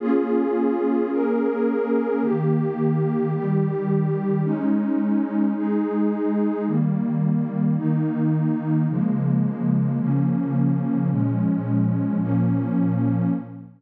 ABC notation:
X:1
M:12/8
L:1/8
Q:3/8=108
K:Bbdor
V:1 name="Pad 2 (warm)"
[B,DFA]6 [B,DAB]6 | [E,B,G]6 [E,G,G]6 | [A,DE]6 [A,EA]6 | [E,G,B,]6 [E,B,E]6 |
[D,F,A,B,]6 [D,F,B,D]6 | [B,,F,A,D]6 [B,,F,B,D]6 |]